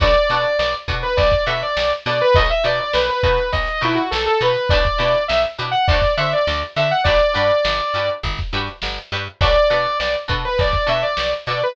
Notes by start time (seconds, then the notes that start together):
0.00 B1 D4 F#4 A4 B4 D5, kick, closed hi-hat
0.15 closed hi-hat
0.29 B2 D4 F#4 A4 B4, snare, closed hi-hat
0.44 closed hi-hat
0.59 B1 D5, snare
0.74 closed hi-hat
0.88 B2 D4 F#4 A4 B4, kick, closed hi-hat
1.03 B4, closed hi-hat
1.17 B1 D5, kick, closed hi-hat
1.31 kick, snare, closed hi-hat
1.46 B2 D4 F#4 A4 B4 E5, closed hi-hat
1.62 D5, closed hi-hat
1.77 B1, snare
1.91 closed hi-hat
2.05 B2 D4 F#4 A4 B4 D5, snare, closed hi-hat
2.20 B4, snare, closed hi-hat
2.35 B1 D#4 F#4 A4 B4 D#5, kick, closed hi-hat
2.49 E5, closed hi-hat
2.64 B2 D#4 F#4 A4 B4 D5, closed hi-hat
2.80 D5, closed hi-hat
2.93 B1 B4, snare
3.09 B4, closed hi-hat
3.23 B2 D#4 F#4 A4 B4, kick, closed hi-hat
3.38 closed hi-hat
3.52 B1 D#5, kick, closed hi-hat
3.67 snare, closed hi-hat
3.81 B2 D#4 E4 F#4 A4 B4, closed hi-hat
3.95 F#4, closed hi-hat
4.11 B1 A4, snare
4.26 A4, closed hi-hat
4.41 B2 D#4 F#4 A4 B4, snare, closed hi-hat
4.56 closed hi-hat
4.69 B1 D4 E4 G4 B4 D5, kick, closed hi-hat
4.85 kick, closed hi-hat
4.98 B2 D4 E4 G4 B4, closed hi-hat
5.14 snare, closed hi-hat
5.28 B1 E5, snare
5.45 closed hi-hat
5.58 B2 D4 E4 G4 B4, snare, closed hi-hat
5.71 F#5, closed hi-hat
5.88 D2 D4 F#4 A4 C5 D5, kick, closed hi-hat
6.02 kick, snare, closed hi-hat
6.17 D3 D4 F#4 A4 C5 E5, closed hi-hat
6.32 D5, closed hi-hat
6.47 D2, snare
6.63 closed hi-hat
6.76 D3 D4 F#4 A4 C5 E5, closed hi-hat
6.91 F#5, snare, closed hi-hat
7.04 G1 D4 F#4 G4 B4 D5, kick, closed hi-hat
7.20 closed hi-hat
7.34 G2 D4 F#4 G4 B4, closed hi-hat
7.50 closed hi-hat
7.65 G1, snare
7.80 closed hi-hat
7.93 G2 D4 F#4 G4 B4, snare, closed hi-hat
8.09 closed hi-hat
8.23 G1, kick, closed hi-hat
8.38 kick, snare, closed hi-hat
8.52 G2 D4 F#4 G4 B4, closed hi-hat
8.67 snare, closed hi-hat
8.82 G1, snare
8.98 closed hi-hat
9.12 G2 D4 F#4 G4 B4, closed hi-hat
9.26 closed hi-hat
9.41 B1 D4 F#4 A4 B4 D5, kick, closed hi-hat
9.56 closed hi-hat
9.70 B2 D4 F#4 A4 B4, snare, closed hi-hat
9.86 closed hi-hat
10.00 B1 D5, snare
10.15 closed hi-hat
10.28 B2 D4 F#4 A4 B4, kick, closed hi-hat
10.45 B4, closed hi-hat
10.58 B1 D5, kick, closed hi-hat
10.73 kick, snare, closed hi-hat
10.87 B2 D4 F#4 A4 B4 E5, closed hi-hat
11.02 D5, closed hi-hat
11.17 B1, snare
11.33 closed hi-hat
11.46 B2 D4 F#4 A4 B4 D5, snare, closed hi-hat
11.61 B4, snare, closed hi-hat